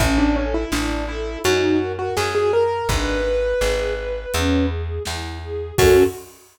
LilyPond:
<<
  \new Staff \with { instrumentName = "Acoustic Grand Piano" } { \time 4/4 \key fis \minor \tempo 4 = 83 e'16 d'16 cis'16 e'16 d'8 e'8 fis'8. fis'16 gis'16 gis'16 ais'8 | b'2~ b'8 r4. | fis'4 r2. | }
  \new Staff \with { instrumentName = "String Ensemble 1" } { \time 4/4 \key fis \minor cis'8 a'8 e'8 a'8 dis'8 ais'8 fis'8 ais'8 | d'8 b'8 gis'8 b'8 cis'8 gis'8 e'8 gis'8 | <cis' fis' a'>4 r2. | }
  \new Staff \with { instrumentName = "Electric Bass (finger)" } { \clef bass \time 4/4 \key fis \minor a,,4 a,,4 fis,4 fis,4 | gis,,4 gis,,4 e,4 e,4 | fis,4 r2. | }
  \new DrumStaff \with { instrumentName = "Drums" } \drummode { \time 4/4 <hh bd>4 sn4 hh4 sn4 | <hh bd>4 sn4 hh4 sn4 | <cymc bd>4 r4 r4 r4 | }
>>